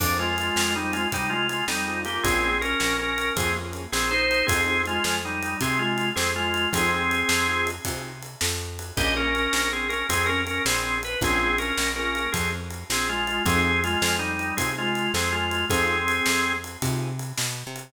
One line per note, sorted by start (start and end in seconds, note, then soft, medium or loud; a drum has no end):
0.00 0.50 F2 medium
0.00 0.26 C4 loud
0.00 0.17 D4 medium
0.00 0.26 D#4 loud
0.00 0.26 F4 loud
0.00 0.26 G#4 loud
0.00 kick medium
0.00 crash loud
0.19 0.74 G#3 medium
0.19 0.74 F4 medium
0.38 ride medium
0.56 1.06 F2 medium
0.56 snare loud
0.75 0.93 G3 medium
0.75 1.02 C4 loud
0.75 0.93 D#4 medium
0.75 1.02 D#4 medium
0.75 1.02 F4 medium
0.75 1.02 G#4 medium
0.93 1.08 G#3 medium
0.93 1.08 F4 medium
0.93 ride medium
1.12 1.63 C3 medium
1.12 1.31 G3 medium
1.12 1.31 D#4 medium
1.12 kick medium
1.12 ride medium
1.30 1.47 G#3 medium
1.30 1.47 F4 medium
1.49 1.65 G#3 medium
1.49 1.65 F4 medium
1.49 ride medium
1.68 2.18 F2 medium
1.68 2.01 G3 medium
1.68 2.01 D#4 medium
1.68 snare medium
1.86 2.04 C4 medium
1.86 2.04 D#4 medium
1.86 2.04 F4 loud
1.86 2.04 G#4 medium
2.05 2.22 A#3 medium
2.05 2.51 A#3 loud
2.05 2.51 C#4 medium
2.05 2.51 F4 loud
2.05 2.22 G4 medium
2.05 2.51 G#4 loud
2.05 ride medium
2.23 2.75 A#1 medium
2.23 2.59 C4 medium
2.23 2.59 G#4 medium
2.23 kick medium
2.23 ride medium
2.61 2.96 C#4 medium
2.61 2.96 A#4 medium
2.61 ride medium
2.80 3.31 A#1 medium
2.80 snare medium
2.99 3.33 C#4 medium
2.99 3.33 A#4 medium
3.18 ride medium
3.36 3.87 F2 medium
3.36 3.50 A#3 medium
3.36 3.54 C4 medium
3.36 3.50 C#4 medium
3.36 3.50 F4 medium
3.36 3.54 G#4 medium
3.36 3.50 G#4 loud
3.36 kick medium
3.36 ride medium
3.56 3.82 A#3 medium
3.56 3.82 C#4 medium
3.56 3.82 F4 medium
3.56 3.82 G#4 loud
3.73 ride medium
3.92 4.43 A#1 medium
3.92 4.11 C4 medium
3.92 4.11 G#4 medium
3.92 snare medium
4.11 4.46 D#4 medium
4.11 4.46 C5 medium
4.31 ride medium
4.47 4.99 F2 medium
4.47 4.82 C4 medium
4.47 4.62 C4 loud
4.47 4.62 D#4 loud
4.47 4.62 F4 loud
4.47 4.82 G#4 medium
4.47 4.62 G#4 loud
4.47 kick loud
4.47 ride loud
4.67 4.93 C4 medium
4.67 4.93 D#4 medium
4.67 4.93 F4 medium
4.67 4.93 G#4 medium
4.86 5.18 G#3 medium
4.86 5.18 F4 medium
4.86 ride medium
5.04 5.55 F2 medium
5.04 snare medium
5.25 5.57 G3 medium
5.25 5.57 D#4 medium
5.43 ride medium
5.61 6.11 C3 medium
5.61 5.80 C4 medium
5.61 5.80 G#4 medium
5.61 kick medium
5.61 ride medium
5.79 6.09 G#3 medium
5.79 6.09 F4 medium
5.98 ride medium
6.16 6.67 F2 medium
6.16 6.31 C4 medium
6.16 6.31 G#4 medium
6.16 snare medium
6.36 6.69 G#3 medium
6.36 6.69 F4 medium
6.54 ride medium
6.73 7.23 F2 medium
6.73 6.99 C4 loud
6.73 7.66 C4 medium
6.73 6.99 D#4 loud
6.73 6.99 F4 loud
6.73 6.99 G#4 loud
6.73 7.66 G#4 medium
6.73 kick medium
6.73 ride loud
7.11 ride medium
7.29 7.79 F2 medium
7.29 snare loud
7.47 7.74 C4 medium
7.47 7.74 D#4 loud
7.47 7.74 F4 medium
7.47 7.74 G#4 medium
7.67 ride medium
7.85 8.36 C3 medium
7.85 8.12 C4 medium
7.85 8.12 D#4 medium
7.85 8.12 F4 medium
7.85 8.12 G#4 medium
7.85 kick medium
7.85 ride medium
8.23 ride medium
8.41 8.92 F2 medium
8.41 snare loud
8.79 ride medium
8.97 9.48 A#1 loud
8.97 9.23 A#3 loud
8.97 9.23 C#4 loud
8.97 9.23 F4 loud
8.97 9.14 G4 medium
8.97 9.23 G#4 loud
8.97 9.14 D#5 medium
8.97 kick loud
8.97 ride medium
9.16 9.69 C#4 medium
9.16 9.69 A#4 medium
9.35 ride medium
9.53 10.04 A#1 medium
9.53 snare medium
9.73 9.88 C4 medium
9.73 9.88 G#4 medium
9.89 10.06 C#4 medium
9.89 10.06 A#4 medium
9.89 ride medium
10.09 10.60 F2 medium
10.09 10.26 C4 medium
10.09 10.26 G#4 medium
10.09 kick medium
10.09 ride loud
10.26 10.42 C#4 medium
10.26 10.42 A#4 medium
10.47 10.62 C#4 medium
10.47 10.62 A#4 medium
10.47 ride medium
10.65 11.16 A#1 medium
10.65 10.99 C4 medium
10.65 10.99 G#4 medium
10.65 snare loud
11.03 11.19 B4 medium
11.03 ride medium
11.21 11.72 A#1 loud
11.21 11.48 A#3 loud
11.21 11.56 C4 medium
11.21 11.48 C#4 medium
11.21 11.48 F4 loud
11.21 11.48 G#4 loud
11.21 11.56 G#4 medium
11.21 kick medium
11.21 ride medium
11.58 11.89 C#4 medium
11.58 11.89 A#4 medium
11.58 ride medium
11.77 12.28 A#1 medium
11.77 snare medium
11.96 12.23 A#3 medium
11.96 12.30 C#4 medium
11.96 12.23 C#4 medium
11.96 12.23 F4 medium
11.96 12.23 G#4 medium
11.96 12.30 A#4 medium
12.15 ride medium
12.32 12.84 F2 medium
12.32 12.50 C4 medium
12.32 12.50 G#4 medium
12.32 kick medium
12.32 ride medium
12.70 ride medium
12.90 13.40 A#1 medium
12.90 13.08 C4 medium
12.90 13.08 G#4 medium
12.90 snare loud
13.09 13.43 G#3 medium
13.09 13.43 F4 medium
13.27 ride medium
13.45 13.96 F2 loud
13.45 13.72 C4 loud
13.45 13.80 C4 medium
13.45 13.72 D#4 loud
13.45 13.72 F4 loud
13.45 13.72 G#4 loud
13.45 13.80 G#4 loud
13.45 kick loud
13.45 ride medium
13.84 14.16 G#3 medium
13.84 14.16 F4 medium
13.84 ride medium
14.02 14.52 F2 medium
14.02 snare loud
14.19 14.55 G3 medium
14.19 14.55 D#4 medium
14.39 ride medium
14.57 15.09 C3 medium
14.57 14.72 C4 medium
14.57 14.84 C4 medium
14.57 14.84 D#4 loud
14.57 14.84 F4 medium
14.57 14.72 G#4 medium
14.57 14.84 G#4 medium
14.57 kick medium
14.57 ride loud
14.78 15.12 G#3 medium
14.78 15.12 F4 medium
14.95 ride medium
15.14 15.64 F2 medium
15.14 15.33 C4 medium
15.14 15.33 G#4 medium
15.14 snare medium
15.32 15.65 G#3 medium
15.32 15.65 F4 medium
15.51 ride medium
15.70 16.21 F2 medium
15.70 15.96 C4 loud
15.70 16.53 C4 medium
15.70 15.96 D#4 loud
15.70 15.96 F4 loud
15.70 15.96 G#4 loud
15.70 16.53 G#4 medium
15.70 kick medium
15.70 ride medium
16.08 ride medium
16.26 16.77 F2 medium
16.26 snare loud
16.64 ride medium
16.82 17.33 C3 medium
16.82 17.08 C4 medium
16.82 17.08 D#4 medium
16.82 17.08 F4 loud
16.82 17.08 G#4 medium
16.82 kick medium
16.82 ride medium
17.19 ride medium
17.38 17.63 B2 medium
17.38 snare loud
17.67 17.92 C3 medium
17.76 ride medium